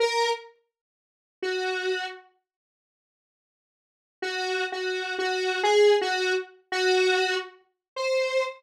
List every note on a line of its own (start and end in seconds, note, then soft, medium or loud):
0.00 0.30 A#4 medium
1.42 2.06 F#4 medium
4.22 4.65 F#4 medium
4.72 5.15 F#4 medium
5.19 5.61 F#4 medium
5.63 5.95 G#4 medium
6.01 6.33 F#4 medium
6.72 7.35 F#4 loud
7.96 8.44 C5 medium